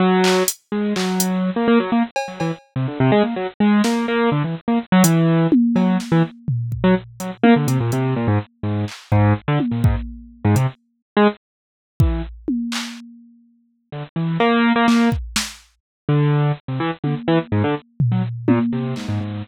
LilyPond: <<
  \new Staff \with { instrumentName = "Acoustic Grand Piano" } { \time 9/8 \tempo 4. = 83 fis4 r8 gis8 fis4~ fis16 ais16 ais16 fis16 ais16 r16 | r16 fis16 e16 r8 c16 d16 c16 gis16 ais16 fis16 r16 gis8 ais8 ais8 | d16 e16 r16 ais16 r16 fis16 e4 r8 fis8 r16 e16 r8 | r8. fis16 r8 fis16 r16 ais16 d16 c16 ais,16 c8 ais,16 gis,16 r8 |
gis,8 r8 gis,8 r16 d16 r16 ais,16 gis,16 r4 gis,16 c16 r16 | r8. gis16 r4. e8 r4. | r2 d16 r16 e8 ais8. ais16 ais8 | r2 d4 r16 c16 e16 r16 d16 r16 |
e16 r16 gis,16 d16 r8. fis16 r8 ais,16 r16 c8 gis,16 gis,16 gis,8 | }
  \new DrumStaff \with { instrumentName = "Drums" } \drummode { \time 9/8 r8 hc8 hh8 r8 hc8 hh8 r4. | cb8 cb4 r4. r8 sn4 | r4. hh4 tommh8 cb8 sn4 | tomfh8 bd4 hh8 tommh8 hh8 hh4. |
r8 hc8 bd8 r8 tommh8 bd8 r4 hh8 | r4. r4 bd8 r8 tommh8 hc8 | r4. r4. cb4 hc8 | bd8 sn4 r4. r4 tommh8 |
r4. tomfh4 tommh8 r8 hc4 | }
>>